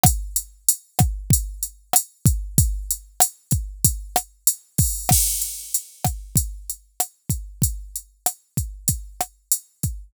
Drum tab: CC |--------|--------|x-------|--------|
HH |xxxxxxxx|xxxxxxxo|-xxxxxxx|xxxxxxxx|
SD |r--r--r-|--r--r--|r--r--r-|--r--r--|
BD |o--oo--o|o--oo--o|o--oo--o|o--oo--o|